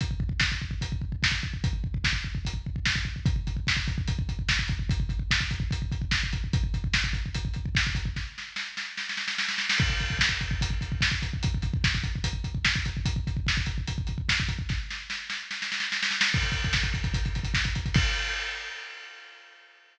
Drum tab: CC |----------------|----------------|----------------|----------------|
HH |x-------x-------|x-------x-------|x-x---x-x-x---x-|x-x---x-x-x---x-|
SD |----o-------o---|----o-------o---|----o-------o---|----o-------o---|
BD |oooooooooooooooo|oooooooooooooooo|oooooooooooooooo|oooooooooooooooo|

CC |----------------|----------------|x---------------|----------------|
HH |x-x---x-x-x---x-|----------------|--x---x-x-x---x-|x-x---x-x-x---x-|
SD |----o-------o---|o-o-o-o-oooooooo|----o-------o---|----o-------o---|
BD |oooooooooooooooo|o---------------|oooooooooooooooo|oooooooooooooooo|

CC |----------------|----------------|x---------------|x---------------|
HH |x-x---x-x-x---x-|----------------|-xxx-xxxxxxx-xxx|----------------|
SD |----o-------o---|o-o-o-o-oooooooo|----o-------o---|----------------|
BD |oooooooooooooooo|o---------------|oooooooooooooooo|o---------------|